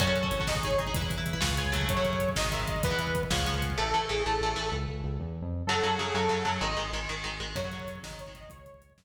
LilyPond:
<<
  \new Staff \with { instrumentName = "Lead 2 (sawtooth)" } { \time 6/8 \key fis \dorian \tempo 4. = 127 cis''4. dis''8 cis''8 dis''8 | r2. | cis''4. dis''8 e''8 dis''8 | b'4. r4. |
a'4 gis'8 a'4. | r2. | a'4 gis'8 a'4. | dis''4 r2 |
cis''4. dis''8 cis''8 dis''8 | cis''4. r4. | }
  \new Staff \with { instrumentName = "Overdriven Guitar" } { \time 6/8 \key fis \dorian <cis' fis' a'>16 <cis' fis' a'>8 <cis' fis' a'>8 <cis' fis' a'>16 <dis' gis'>8 <dis' gis'>8 <dis' gis'>16 <dis' gis'>16 | <e' b'>16 <e' b'>8 <e' b'>8 <e' b'>16 <eis' gis' b' cis''>8 <eis' gis' b' cis''>8 <cis fis a>8~ | <cis fis a>16 <cis fis a>4~ <cis fis a>16 <dis gis>8 <dis gis>4 | <e b>16 <e b>4~ <e b>16 <eis gis b cis'>8 <eis gis b cis'>4 |
<e a>8 <e a>8 <e a>8 <e a>8 <e a>8 <e a>8 | r2. | <cis fis>8 <cis fis>8 <cis fis>8 <cis fis>8 <cis fis>8 <cis fis>8 | <dis gis>8 <dis gis>8 <dis gis>8 <dis gis>8 <dis gis>8 <dis gis>8 |
<cis fis>16 <cis fis>16 <cis fis>4 <dis gis>8. <dis gis>8. | r2. | }
  \new Staff \with { instrumentName = "Synth Bass 1" } { \clef bass \time 6/8 \key fis \dorian fis,4 gis,,2 | e,4. cis,4. | fis,4. gis,,4. | e,4. cis,4. |
a,,8 a,,8 a,,8 a,,8 a,,8 a,,8 | cis,8 cis,8 cis,8 e,8. eis,8. | fis,8 fis,8 fis,8 fis,8 fis,8 fis,8 | gis,,8 gis,,8 gis,,8 gis,,8 gis,,8 gis,,8 |
fis,4. gis,,4. | cis,4. fis,4. | }
  \new DrumStaff \with { instrumentName = "Drums" } \drummode { \time 6/8 <cymc bd>16 bd16 <hh bd>16 bd16 <hh bd>16 bd16 <bd sn>16 bd16 <hh bd>16 bd16 <hh bd>16 bd16 | <hh bd>16 bd16 <hh bd>16 bd16 <hh bd>16 bd16 <bd sn>16 bd16 <hh bd>16 bd16 <hh bd>16 bd16 | <hh bd>16 bd16 <hh bd>16 bd16 <hh bd>16 bd16 <bd sn>16 bd16 <hh bd>16 bd16 <hh bd>16 bd16 | <hh bd>16 bd16 <hh bd>16 bd16 <hh bd>16 bd16 <bd sn>16 bd16 <hh bd>16 bd16 <hh bd>16 bd16 |
r4. r4. | r4. r4. | r4. r4. | r4. r4. |
<cymc bd>16 bd16 <hh bd>16 bd16 <hh bd>16 bd16 <bd sn>16 bd16 <hh bd>16 bd16 <hh bd>16 bd16 | <hh bd>16 bd16 <hh bd>16 bd16 <hh bd>16 bd16 <bd sn>4. | }
>>